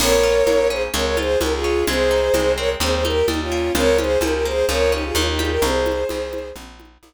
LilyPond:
<<
  \new Staff \with { instrumentName = "Violin" } { \time 4/4 \key bes \dorian \tempo 4 = 128 <bes' des''>4. <aes' c''>16 r16 <bes' des''>16 <bes' des''>16 <aes' c''>8 <g' bes'>16 <f' aes'>8. | <aes' c''>4. <bes' des''>16 r16 <aes' c''>16 <aes' c''>16 <g' bes'>8 <ees' g'>16 <des' f'>8. | <bes' des''>8 <aes' c''>8 <g' bes'>16 <g' bes'>16 <aes' c''>8 <bes' des''>8 <ees' g'>16 <f' aes'>16 <des' f'>16 <ees' g'>16 <f' aes'>16 <g' bes'>16 | <aes' c''>2 r2 | }
  \new Staff \with { instrumentName = "Acoustic Guitar (steel)" } { \time 4/4 \key bes \dorian bes8 f'8 bes8 des'8 aes8 f'8 aes8 des'8 | aes8 ees'8 aes8 c'8 g8 ees'8 g8 bes8 | f8 des'8 f8 bes8 f8 des'8 ees8 g8 | r1 | }
  \new Staff \with { instrumentName = "Electric Bass (finger)" } { \clef bass \time 4/4 \key bes \dorian bes,,4 bes,,4 des,4 des,4 | c,4 c,4 ees,4 ees,4 | des,4 des,4 des,4 ees,4 | c,4 c,4 bes,,4 bes,,4 | }
  \new DrumStaff \with { instrumentName = "Drums" } \drummode { \time 4/4 <cgl cymc>4 cgho4 cgl8 cgho8 cgho4 | cgl4 cgho4 cgl8 cgho8 cgho4 | cgl8 cgho8 cgho4 cgl4 cgho8 cgho8 | cgl8 cgho8 cgho8 cgho8 cgl8 cgho8 cgho4 | }
>>